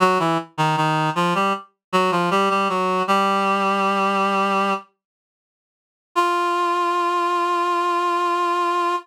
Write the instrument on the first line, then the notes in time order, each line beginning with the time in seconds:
clarinet
0.00 F#3 F#4
0.19 E3 E4
0.58 D#3 D#4
0.77 D#3 D#4
1.15 F3 F4
1.35 G3 G4
1.92 F#3 F#4
2.11 F3 F4
2.31 G3 G4
2.50 G3 G4
2.69 F#3 F#4
3.08 G3 G4
6.15 F4